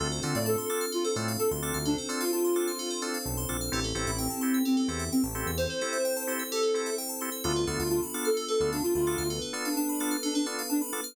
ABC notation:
X:1
M:4/4
L:1/16
Q:1/4=129
K:Dm
V:1 name="Ocarina"
z3 d A4 F A z2 A z3 | D z2 F F8 z4 | z3 E C4 C C z2 C z3 | c8 A4 z4 |
F2 z F F z2 A2 A2 D F F3 | z3 D D4 D D z2 D z3 |]
V:2 name="Drawbar Organ"
[CDFA]2 [CDFA]4 [CDFA]4 [CDFA]4 [CDFA]2- | [CDFA]2 [CDFA]4 [CDFA]4 [CDFA]4 [CDFA]2 | [CEGA]2 [CEGA]4 [CEGA]4 [CEGA]4 [CEGA]2- | [CEGA]2 [CEGA]4 [CEGA]4 [CEGA]4 [CEGA]2 |
[=B,DFA]2 [B,DFA]4 [B,DFA]4 [B,DFA]4 [B,DFA]2- | [=B,DFA]2 [B,DFA]4 [B,DFA]4 [B,DFA]4 [B,DFA]2 |]
V:3 name="Tubular Bells"
A c d f a c' d' f' A c d f a c' d' f' | A c d f a c' d' f' A c d f a c' d' f' | G A c e g a c' e' G A c e g a c' e' | G A c e g a c' e' G A c e g a c' e' |
A =B d f a =b d' f' A B d f a b d' f' | A =B d f a =b d' f' A B d f a b d' f' |]
V:4 name="Synth Bass 1" clef=bass
D,,2 D, A,,7 A,,3 D,,2 D,,- | D,,12 =B,,,2 _B,,,2 | A,,,2 A,,, A,,,7 E,,3 A,,,2 E,,- | E,,16 |
D,,2 D,, D,,7 D,,3 D,,2 D,,- | D,,16 |]
V:5 name="Pad 5 (bowed)"
[CDFA]16 | [CDAc]16 | [CEGA]16 | [CEAc]16 |
[=B,DFA]16 | [=B,DA=B]16 |]